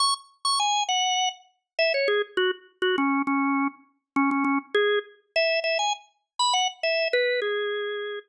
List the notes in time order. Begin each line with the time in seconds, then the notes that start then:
0.00 C#6
0.45 C#6
0.60 G#5
0.88 F#5
1.79 E5
1.94 C#5
2.08 G#4
2.37 F#4
2.82 F#4
2.98 C#4
3.27 C#4
4.16 C#4
4.31 C#4
4.44 C#4
4.75 G#4
5.36 E5
5.64 E5
5.79 G#5
6.39 B5
6.53 F#5
6.83 E5
7.13 B4
7.42 G#4